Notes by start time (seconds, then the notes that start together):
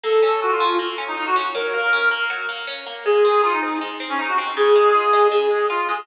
0.03 A#3 A4
0.22 C#4
0.42 F4 F#4
0.51 F4
0.60 C#4
0.79 A#3
0.98 C#4
1.08 D#4
1.17 D#4 F4
1.26 F#4
1.36 C#4
1.54 F#3 A#4
1.74 A#3
1.93 C#4
2.11 A#3
2.30 F#3
2.49 A#3
2.67 C#4
2.87 A#3
3.05 G#3 G#4
3.25 C4
3.43 D#4 F4
3.53 D#4
3.62 C4
3.81 G#3
4.00 C4
4.09 C#4
4.19 D#4
4.28 F#4
4.38 C4
4.57 C#3 G#4
4.75 G#3
4.95 F4
5.13 G#3
5.31 C#3 G#4
5.51 G#3
5.69 F4
5.89 G#3 G#4